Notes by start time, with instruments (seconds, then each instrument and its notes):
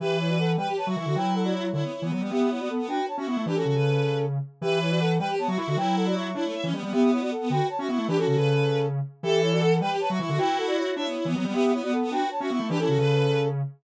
0.00 lead 1 (square) E3, brass section G4 E5, violin B4
0.19 brass section E4 C#5
0.29 brass section F#4 D5
0.38 brass section A4 F#5
0.58 lead 1 (square) G3, violin B4, brass section B4 G5
0.67 violin G4
0.77 violin B4, brass section C#5 A5
0.87 lead 1 (square) F#3, violin F#4, brass section E5 C#6
0.96 lead 1 (square) E3, violin E4, brass section E5 C#6
1.06 lead 1 (square) D3, violin F#4
1.15 lead 1 (square) F#3, violin E4, brass section B4 G5
1.35 brass section A4 F#5
1.44 brass section F#4 D5
1.54 brass section E4 C#5
1.73 lead 1 (square) D3, violin E4, brass section E4 C#5
1.83 violin B3
1.92 violin E4
2.02 lead 1 (square) E3, violin B3
2.11 lead 1 (square) F#3, violin B3
2.21 lead 1 (square) G3, violin B3
2.31 violin B3, lead 1 (square) B3, brass section G4 E5
2.40 violin B3
2.50 violin B3, brass section E4 C#5
2.59 violin B3, brass section F#4 D5
2.69 brass section A4 F#5
2.79 violin B3
2.88 lead 1 (square) D4, violin F#4, brass section B4 G5
3.08 brass section C#5 A5
3.17 lead 1 (square) C#4, violin F#4, brass section E5 C#6
3.27 lead 1 (square) B3, violin E4, brass section E5 C#6
3.37 lead 1 (square) A3
3.46 lead 1 (square) E3, brass section D4 B4, violin G4
3.56 brass section C#4 A4, violin F#4
3.65 lead 1 (square) C#3, violin F#4
3.75 lead 1 (square) C#3, violin B4
4.61 lead 1 (square) E3, brass section G4 E5, violin B4
4.81 brass section E4 C#5
4.90 brass section F#4 D5
5.00 brass section A4 F#5
5.19 lead 1 (square) G3, violin B4, brass section B4 G5
5.29 violin G4
5.38 violin B3, brass section C#5 A5
5.48 lead 1 (square) F#3, violin F#4, brass section E5 C#6
5.58 lead 1 (square) E4, violin E4, brass section E5 C#6
5.67 lead 1 (square) D3, violin F#4
5.77 lead 1 (square) F#3, violin E4, brass section B4 G5
5.96 brass section A4 F#5
6.06 brass section F#4 D5
6.15 brass section E5 C#6
6.35 lead 1 (square) D4, brass section E4 C#5, violin E4
6.44 violin A3
6.54 violin E5
6.63 lead 1 (square) E3, violin C#4
6.73 lead 1 (square) G3, violin B3
6.82 lead 1 (square) G3, violin B3
6.92 violin B3, lead 1 (square) B3, brass section G4 E5
7.02 violin B3
7.12 violin B3, brass section E4 C#5
7.21 violin B3, brass section F#4 D5
7.31 brass section A4 F#5
7.41 violin B3
7.50 lead 1 (square) D3, violin F#4, brass section B4 G5
7.69 brass section C#5 A5
7.79 lead 1 (square) C#4, violin F#4, brass section E5 C#6
7.88 lead 1 (square) B3, violin E4, brass section E5 C#6
7.98 lead 1 (square) A3
8.08 lead 1 (square) E3, brass section D4 B4, violin G4
8.17 brass section C#4 A4, violin F#4
8.27 lead 1 (square) C#3, violin F#4
8.36 lead 1 (square) C#3, violin B4
9.23 lead 1 (square) E3, brass section G4 E5, violin A4
9.42 brass section E4 C#5
9.52 brass section F#4 D5
9.62 brass section A4 F#5
9.81 lead 1 (square) G3, violin B4, brass section B4 G5
9.90 violin G4
10.00 violin B4, brass section C#5 A5
10.10 lead 1 (square) F#3, violin F#4, brass section E5 C#6
10.19 lead 1 (square) E3, violin E4, brass section E5 C#6
10.29 lead 1 (square) D3, violin F#4
10.38 violin E4, lead 1 (square) F#4, brass section B4 G5
10.58 brass section A4 F#5
10.67 brass section F#4 D5
10.77 brass section E4 C#5
10.96 lead 1 (square) D4, brass section E4 C#5, violin E5
11.06 violin B3
11.15 violin E4
11.25 lead 1 (square) E3, violin B3
11.35 lead 1 (square) F#3, violin B3
11.44 lead 1 (square) G3, violin B3
11.54 lead 1 (square) B3, violin B3, brass section G4 E5
11.63 violin B3
11.73 violin B3, brass section E4 C#5
11.82 violin B3, brass section F#4 D5
11.92 brass section A4 F#5
12.02 violin B3
12.11 lead 1 (square) D4, violin F#4, brass section B4 G5
12.31 brass section C#5 A5
12.40 lead 1 (square) C#4, violin F#4, brass section E5 C#6
12.50 lead 1 (square) B3, violin E4, brass section E5 C#6
12.60 lead 1 (square) A3
12.69 lead 1 (square) E3, brass section D4 B4, violin G4
12.79 brass section C#4 A4, violin E4
12.88 lead 1 (square) C#3, violin F#4
12.98 lead 1 (square) C#3, violin B4